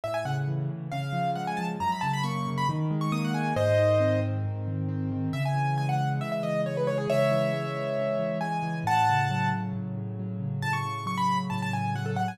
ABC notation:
X:1
M:4/4
L:1/16
Q:1/4=136
K:C#m
V:1 name="Acoustic Grand Piano"
e g f z5 ^e4 f g a z | ^a b =a b c'3 b z3 c' d' f g2 | [^Bd]6 z10 | e g3 g f2 z e e d2 c B c G |
[ce]12 g4 | [fa]6 z10 | a c'3 c' b2 z a a g2 f A f g |]
V:2 name="Acoustic Grand Piano"
A,,2 C,2 E,2 C,2 C,2 ^E,2 G,2 E,2 | F,,2 C,2 ^A,2 C,2 D,2 G,2 A,2 G,2 | G,,2 D,2 ^B,2 D,2 G,,2 D,2 B,2 D,2 | C,2 E,2 G,2 E,2 C,2 E,2 G,2 E,2 |
C,2 E,2 G,2 E,2 C,2 E,2 G,2 E,2 | A,,2 C,2 F,2 C,2 A,,2 C,2 F,2 C,2 | A,,2 C,2 F,2 C,2 A,,2 C,2 F,2 C,2 |]